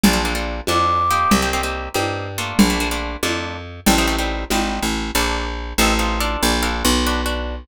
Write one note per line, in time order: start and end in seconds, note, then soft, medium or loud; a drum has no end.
0.03 0.61 A#1 loud
0.03 0.13 A#3 medium
0.03 0.13 D4 medium
0.03 0.13 F4 medium
0.03 0.13 A4 medium
0.03 low conga loud
0.13 0.22 A#3 medium
0.13 0.22 D4 medium
0.13 0.22 F4 medium
0.13 0.22 A4 medium
0.25 0.33 A#3 medium
0.25 0.33 D4 medium
0.25 0.33 F4 medium
0.25 0.33 A4 medium
0.35 0.60 A#3 medium
0.35 0.60 D4 medium
0.35 0.60 F4 medium
0.35 0.60 A4 medium
0.67 1.26 F2 medium
0.67 1.03 A#3 medium
0.67 1.03 D4 medium
0.67 1.03 F4 medium
0.67 1.03 A4 medium
0.67 1.30 D6 medium
0.67 high conga medium
1.11 1.40 A#3 medium
1.11 1.40 C4 medium
1.11 1.40 D#4 medium
1.11 1.40 G4 medium
1.31 1.89 C2 medium
1.31 low conga medium
1.42 1.51 A#3 medium
1.42 1.51 C4 medium
1.42 1.51 D#4 medium
1.42 1.51 G4 medium
1.53 1.62 A#3 medium
1.53 1.62 C4 medium
1.53 1.62 D#4 medium
1.53 1.62 G4 medium
1.63 1.89 A#3 medium
1.63 1.89 C4 medium
1.63 1.89 D#4 medium
1.63 1.89 G4 medium
1.94 2.53 G2 medium
1.94 2.28 A#3 medium
1.94 2.28 C4 medium
1.94 2.28 D#4 medium
1.94 2.28 G4 medium
1.94 high conga medium
2.38 2.68 A3 medium
2.38 2.68 A#3 medium
2.38 2.68 D4 medium
2.38 2.68 F4 loud
2.59 3.16 A#1 medium
2.59 low conga loud
2.70 2.78 A3 medium
2.70 2.78 A#3 medium
2.70 2.78 D4 medium
2.70 2.78 F4 medium
2.80 2.89 A3 medium
2.80 2.89 A#3 medium
2.80 2.89 D4 medium
2.80 2.89 F4 medium
2.91 3.17 A3 medium
2.91 3.17 A#3 medium
2.91 3.17 D4 medium
2.91 3.17 F4 medium
3.23 3.80 F2 medium
3.23 3.57 A3 medium
3.23 3.57 A#3 medium
3.23 3.57 D4 medium
3.23 3.57 F4 medium
3.23 high conga medium
3.86 4.45 A1 loud
3.86 3.95 G3 loud
3.86 3.95 A3 medium
3.86 3.95 C4 loud
3.86 3.95 D#4 medium
3.86 low conga medium
3.98 4.07 G3 medium
3.98 4.07 A3 medium
3.98 4.07 C4 medium
3.98 4.07 D#4 medium
4.07 4.16 G3 medium
4.07 4.16 A3 medium
4.07 4.16 C4 medium
4.07 4.16 D#4 medium
4.19 4.44 G3 medium
4.19 4.44 A3 medium
4.19 4.44 C4 medium
4.19 4.44 D#4 medium
4.50 4.79 G#1 medium
4.50 4.85 G3 medium
4.50 4.85 A3 medium
4.50 4.85 C4 medium
4.50 4.85 D#4 medium
4.50 high conga medium
4.82 5.11 A1 medium
5.15 5.74 A#1 medium
5.15 5.45 A#3 medium
5.15 5.45 D4 medium
5.15 5.45 F4 medium
5.15 5.45 A4 medium
5.78 6.37 A1 loud
5.78 5.94 C4 loud
5.78 5.94 D#4 loud
5.78 5.94 F4 loud
5.78 5.94 A4 loud
5.99 6.19 C4 medium
5.99 6.19 D#4 medium
5.99 6.19 F4 medium
5.99 6.19 A4 medium
6.20 6.57 D4 loud
6.20 6.57 F4 loud
6.20 6.57 A4 loud
6.20 6.57 A#4 medium
6.43 6.83 A#1 loud
6.63 6.92 D4 medium
6.63 6.92 F4 medium
6.63 6.92 A4 medium
6.63 6.92 A#4 loud
6.85 7.65 B1 loud
7.06 7.21 D4 loud
7.06 7.21 F#4 loud
7.06 7.21 B4 medium
7.26 7.55 D4 medium
7.26 7.55 F#4 medium
7.26 7.55 B4 medium